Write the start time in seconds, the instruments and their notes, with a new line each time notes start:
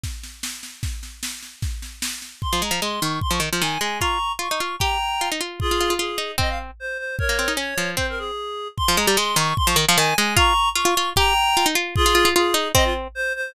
0.03 kick, snare
0.23 snare
0.43 snare
0.63 snare
0.83 kick, snare
1.03 snare
1.23 snare
1.43 snare
1.62 kick, snare
1.82 snare
2.02 snare
2.22 snare
2.42 clarinet C6, kick
2.53 harpsichord F3
2.62 harpsichord G#3, clarinet A#5
2.71 harpsichord F3
2.82 harpsichord G#3, clarinet C6
3.01 harpsichord D#3, clarinet C#6
3.21 clarinet C6, kick
3.31 harpsichord F3, clarinet C#6
3.40 harpsichord D#3
3.53 harpsichord F3
3.61 harpsichord D#3, clarinet G#5
3.81 harpsichord G#3, clarinet G#5
4.00 harpsichord F4, clarinet A#5 C#6, kick
4.39 harpsichord F4, clarinet C#6
4.51 harpsichord D#4
4.60 harpsichord F4
4.79 harpsichord G4, clarinet G5 A#5, kick
5.21 harpsichord F4
5.32 harpsichord D#4
5.41 harpsichord F4
5.60 clarinet F4 G#4, kick
5.71 harpsichord F4
5.80 harpsichord F4
5.90 harpsichord F4
5.99 harpsichord F4, clarinet G#4
6.18 harpsichord D#4
6.38 harpsichord C4, clarinet D#5, kick
6.49 clarinet F5
6.80 clarinet C5
6.98 clarinet C5
7.19 clarinet A#4 C#5, kick
7.29 harpsichord A#3
7.39 harpsichord C4
7.48 harpsichord D#4
7.57 harpsichord C#4, clarinet C#5
7.78 harpsichord F3
7.97 harpsichord C4, clarinet C5, kick
8.09 clarinet A#4
8.18 clarinet G#4
8.77 clarinet C6, kick
8.88 harpsichord F3
8.97 harpsichord G#3, clarinet A#5
9.07 harpsichord G3
9.17 harpsichord G#3, clarinet C6
9.36 harpsichord D#3, clarinet C#6
9.57 clarinet C6, kick
9.67 harpsichord F3, clarinet C#6
9.76 harpsichord D#3
9.88 harpsichord F3
9.97 harpsichord D#3, clarinet G#5
10.16 harpsichord G#3, clarinet G#5
10.37 harpsichord F4, clarinet A#5 C#6, kick
10.75 harpsichord F4, clarinet C#6
10.85 harpsichord F4
10.97 harpsichord F4
11.16 harpsichord G4, clarinet G5 A#5, kick
11.57 harpsichord F4
11.66 harpsichord D#4
11.75 harpsichord F4
11.96 clarinet F4 G#4, kick
12.06 harpsichord F4
12.15 harpsichord F4
12.25 harpsichord F4
12.35 harpsichord F4, clarinet G#4
12.54 harpsichord D#4
12.74 harpsichord C4, clarinet D#5, kick
12.84 clarinet F4
13.15 clarinet C5
13.35 clarinet C5